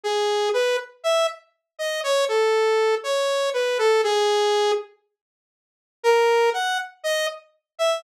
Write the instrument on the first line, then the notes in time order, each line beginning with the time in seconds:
lead 2 (sawtooth)
0.04 G#4
0.54 B4
1.04 E5
1.79 D#5
2.04 C#5
2.28 A4
3.04 C#5
3.54 B4
3.78 A4
4.04 G#4
6.03 A#4
6.54 F#5
7.04 D#5
7.79 E5